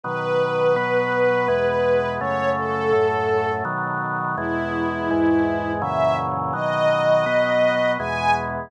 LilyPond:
<<
  \new Staff \with { instrumentName = "String Ensemble 1" } { \time 3/4 \key e \major \tempo 4 = 83 b'2. | cis''8 a'4. r4 | e'2 e''8 r8 | dis''2 gis''8 r8 | }
  \new Staff \with { instrumentName = "Drawbar Organ" } { \time 3/4 \key e \major <b, dis fis>4 <b, fis b>4 <e, b, gis>4 | <fis, cis a>4 <fis, a, a>4 <b, dis fis>4 | <e, b, gis>4 <e, gis, gis>4 <fis, ais, cis e>4 | <b, dis fis>4 <b, fis b>4 <e, b, gis>4 | }
>>